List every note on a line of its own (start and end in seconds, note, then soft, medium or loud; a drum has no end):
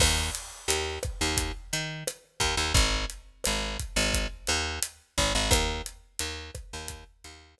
0.00 0.30 D#2 loud
0.00 kick loud
0.00 cross-stick loud
0.00 crash loud
0.35 closed hi-hat loud
0.68 0.99 D#2 medium
0.68 closed hi-hat loud
1.03 kick medium
1.03 cross-stick loud
1.03 closed hi-hat medium
1.21 1.52 D#2 loud
1.37 kick loud
1.37 closed hi-hat loud
1.73 2.04 D#3 medium
1.73 closed hi-hat medium
2.07 cross-stick loud
2.07 closed hi-hat loud
2.40 2.55 D#2 loud
2.40 kick medium
2.40 closed hi-hat medium
2.57 2.73 D#2 medium
2.74 3.05 G#1 loud
2.74 kick loud
2.74 closed hi-hat loud
3.10 closed hi-hat medium
3.44 3.77 G#1 medium
3.44 cross-stick loud
3.44 closed hi-hat loud
3.79 kick medium
3.79 closed hi-hat medium
3.96 4.27 G#1 loud
4.14 kick loud
4.14 closed hi-hat loud
4.47 4.79 D#2 loud
4.47 cross-stick medium
4.47 closed hi-hat medium
4.82 closed hi-hat loud
5.18 5.33 G#1 loud
5.18 kick loud
5.18 closed hi-hat medium
5.35 5.50 G#1 medium
5.51 5.82 D#2 loud
5.51 kick loud
5.51 cross-stick loud
5.51 closed hi-hat loud
5.86 closed hi-hat medium
6.19 6.51 D#2 medium
6.19 closed hi-hat loud
6.55 kick loud
6.55 cross-stick medium
6.55 closed hi-hat medium
6.73 7.04 D#2 medium
6.88 kick medium
6.88 closed hi-hat loud
7.24 7.55 D#2 medium
7.24 closed hi-hat medium
7.58 cross-stick loud
7.58 closed hi-hat loud